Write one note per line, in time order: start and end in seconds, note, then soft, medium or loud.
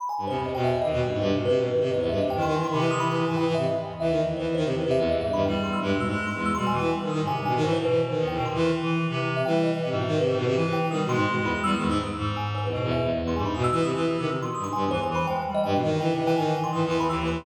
0.00 0.08 B5 loud
0.09 0.26 G#5 medium
0.18 0.26 G2 medium
0.27 0.52 E2 medium
0.27 0.36 C3 medium
0.27 0.44 C5 medium
0.37 0.53 C3 medium
0.45 0.54 D#5 medium
0.54 0.79 E2 medium
0.54 0.71 B2 medium
0.54 0.63 G5 medium
0.64 0.72 E5 medium
0.82 1.07 D#2 medium
0.82 0.91 D#3 medium
0.82 0.98 D#5 loud
0.93 1.01 B2 loud
1.02 1.10 G2 soft
1.10 1.27 G2 medium
1.10 1.22 G#2 medium
1.18 1.31 G2 loud
1.18 1.35 C5 medium
1.28 1.61 C3 medium
1.33 1.44 B2 medium
1.45 1.58 C3 loud
1.45 1.54 B4 loud
1.56 1.67 B2 medium
1.63 2.12 G#2 medium
1.63 1.80 B4 medium
1.72 1.82 D#3 medium
1.81 1.89 C3 loud
1.81 1.90 B4 medium
1.91 2.00 E2 medium
1.91 1.99 D#5 medium
2.00 2.09 E2 loud
2.00 2.08 C5 medium
2.09 2.19 G2 loud
2.09 2.17 E5 medium
2.18 2.35 C3 medium
2.18 2.36 C3 medium
2.18 2.29 D#5 medium
2.30 2.41 G5 loud
2.36 2.68 D#3 loud
2.36 2.44 E3 medium
2.42 2.54 D#3 loud
2.42 2.53 C6 medium
2.55 2.66 E3 medium
2.55 2.63 G#5 medium
2.64 2.72 C6 loud
2.69 3.22 C3 loud
2.69 2.80 D#3 medium
2.69 2.81 B5 medium
2.78 2.89 E3 loud
2.78 2.90 C6 medium
2.91 3.07 E3 medium
2.91 2.99 D#6 loud
3.00 3.08 B5 loud
3.08 3.16 E3 medium
3.18 3.26 E3 medium
3.26 3.75 G#2 medium
3.26 3.37 E3 medium
3.26 3.36 G#5 medium
3.36 3.46 E3 loud
3.36 3.45 G5 medium
3.47 3.55 E3 loud
3.55 3.65 C3 medium
3.55 3.63 E5 loud
3.64 3.80 D#5 medium
3.83 3.99 E2 medium
3.99 4.32 D#2 medium
3.99 4.11 E3 medium
3.99 4.16 E5 loud
4.10 4.21 D#3 medium
4.18 4.35 D#5 medium
4.25 4.36 E3 medium
4.36 5.02 E2 medium
4.36 4.46 E3 medium
4.36 4.53 C5 medium
4.47 4.55 E3 medium
4.55 4.64 D#3 loud
4.55 4.63 C5 loud
4.65 4.73 C3 medium
4.74 4.85 E3 medium
4.82 4.96 C3 medium
4.82 4.90 B4 medium
4.91 4.99 E5 loud
4.97 5.08 E2 loud
4.97 5.08 E5 medium
5.09 5.17 D#2 medium
5.09 5.21 E2 medium
5.09 5.20 D#5 loud
5.18 5.32 G2 medium
5.18 5.35 G#2 medium
5.18 5.32 E5 loud
5.33 5.44 G2 loud
5.33 5.44 B5 medium
5.37 5.45 D#3 medium
5.45 5.53 E2 medium
5.45 5.79 G3 loud
5.45 5.54 G5 medium
5.64 5.80 E2 medium
5.64 5.72 C6 medium
5.73 5.81 E6 medium
5.81 5.92 G2 loud
5.81 6.06 G#3 medium
5.94 6.05 B2 medium
6.00 6.15 G#2 medium
6.00 6.08 E6 medium
6.09 6.25 G#3 loud
6.09 6.17 E6 medium
6.18 6.26 E6 medium
6.26 6.50 G#3 medium
6.26 6.35 C6 medium
6.35 6.51 E2 medium
6.45 6.54 E6 loud
6.55 6.67 B2 medium
6.55 6.72 G3 medium
6.55 6.66 C6 loud
6.67 6.78 B2 medium
6.67 6.78 G#5 medium
6.73 6.89 E3 loud
6.79 6.90 E3 loud
6.79 6.90 G5 medium
6.92 7.25 G3 medium
7.02 7.11 D#3 medium
7.09 7.20 D#3 medium
7.09 7.25 D#6 medium
7.20 7.29 G#2 medium
7.27 7.60 C3 medium
7.27 7.36 G#5 loud
7.37 7.45 G2 medium
7.45 7.54 B2 medium
7.45 7.62 G#5 medium
7.56 7.64 D#3 loud
7.62 7.79 G#2 loud
7.62 7.75 E3 loud
7.62 7.72 C5 medium
7.73 7.86 E3 medium
7.73 7.81 C5 loud
7.82 8.14 B2 medium
7.82 7.98 B4 medium
7.89 8.00 E3 medium
8.09 8.25 D#3 medium
8.18 8.35 E2 loud
8.27 8.37 E3 medium
8.27 8.44 G5 medium
8.35 8.46 B2 loud
8.35 8.54 D#3 medium
8.45 8.60 C3 medium
8.45 8.54 C6 medium
8.54 8.71 E3 loud
8.61 8.72 D#3 medium
8.61 8.72 C6 medium
8.73 8.98 E3 medium
8.82 9.07 E3 loud
9.09 9.42 C3 loud
9.09 9.19 E3 medium
9.21 9.29 E3 medium
9.36 9.45 C3 medium
9.36 9.44 E5 medium
9.45 9.71 E3 loud
9.45 9.79 G3 medium
9.45 9.54 G5 medium
9.64 9.72 D#5 medium
9.73 9.82 E3 medium
9.73 9.81 G5 soft
9.80 9.88 C3 medium
9.80 9.94 C3 medium
9.90 10.15 G#2 loud
9.90 10.05 B2 medium
10.00 10.08 E5 medium
10.07 10.18 D#3 loud
10.18 10.35 C3 medium
10.18 10.26 B4 medium
10.27 10.52 G#2 loud
10.27 10.44 C5 medium
10.37 10.45 B2 loud
10.46 10.54 C3 loud
10.55 10.65 E3 medium
10.55 10.88 E3 loud
10.65 10.76 E3 medium
10.73 10.81 G5 loud
10.77 10.88 E3 medium
10.90 11.01 D#3 medium
10.90 11.07 G3 medium
10.90 11.07 D#6 medium
11.04 11.15 B2 loud
11.09 11.59 G#3 loud
11.09 11.25 C6 loud
11.15 11.26 G#2 loud
11.27 11.38 B2 medium
11.41 11.51 E2 loud
11.45 11.54 B5 medium
11.52 11.62 E2 medium
11.52 11.63 D#6 medium
11.63 11.75 E2 loud
11.63 11.74 G3 loud
11.63 11.72 E6 loud
11.73 11.87 D#3 medium
11.73 11.89 D#6 medium
11.78 11.89 E2 medium
11.87 11.98 G#2 loud
11.87 11.99 E6 loud
12.01 12.17 G2 medium
12.17 12.67 G#2 loud
12.36 12.45 G#5 medium
12.55 12.63 C5 medium
12.64 12.72 E2 medium
12.64 12.72 B4 medium
12.72 12.81 G#2 medium
12.72 13.05 B2 medium
12.72 12.89 D#5 medium
12.84 12.92 E2 loud
12.91 13.01 E2 medium
12.91 13.07 E5 medium
13.02 13.10 E2 medium
13.11 13.22 E2 medium
13.22 13.33 E2 medium
13.27 13.36 C6 medium
13.34 13.45 G2 medium
13.34 13.61 G#2 medium
13.34 13.45 G#5 medium
13.45 13.55 G#2 medium
13.45 13.54 B5 medium
13.55 13.67 B2 loud
13.55 13.63 D#6 medium
13.64 13.72 E6 loud
13.72 13.83 E3 loud
13.72 13.81 E6 loud
13.82 13.93 C3 medium
13.82 13.90 D#6 medium
13.95 14.06 E3 loud
14.06 14.17 E3 medium
14.18 14.27 C3 loud
14.18 14.27 D#3 medium
14.18 14.29 E6 medium
14.28 14.36 C3 medium
14.28 14.41 E6 medium
14.39 14.47 B2 medium
14.39 14.53 C6 medium
14.55 14.65 G2 medium
14.55 14.63 D#6 medium
14.64 14.74 G#2 soft
14.64 14.72 C6 loud
14.73 14.83 G2 medium
14.73 14.89 G#5 medium
14.84 14.92 E2 medium
14.91 15.17 E2 medium
14.91 14.99 E3 loud
14.91 15.02 C5 loud
15.03 15.14 G#5 medium
15.10 15.26 E3 loud
15.15 15.26 B5 medium
15.26 15.42 G#3 medium
15.26 15.35 G5 loud
15.36 15.45 G5 medium
15.46 15.70 G3 medium
15.55 15.63 D#5 loud
15.64 15.73 G2 loud
15.64 15.80 G5 medium
15.72 15.82 B2 medium
15.72 15.97 E3 medium
15.83 15.99 D#3 loud
16.00 16.11 E3 loud
16.00 16.08 G5 medium
16.09 16.34 C3 medium
16.15 16.23 E3 medium
16.15 16.26 D#5 medium
16.24 16.35 E3 loud
16.24 16.35 G5 loud
16.36 16.45 G#2 medium
16.36 16.53 D#3 loud
16.36 16.53 G#5 loud
16.46 16.71 E3 medium
16.55 16.63 G5 medium
16.64 16.72 C6 loud
16.73 16.82 G#2 medium
16.73 16.84 E3 medium
16.73 16.81 D#6 soft
16.83 17.07 E2 medium
16.83 16.97 E3 loud
16.91 16.99 C6 medium
16.98 17.07 E3 medium
16.98 17.08 B5 loud
17.07 17.42 D#2 loud
17.07 17.15 E3 medium
17.07 17.17 E6 medium
17.20 17.29 E3 medium
17.27 17.38 E3 medium
17.27 17.44 C6 medium
17.38 17.45 C3 medium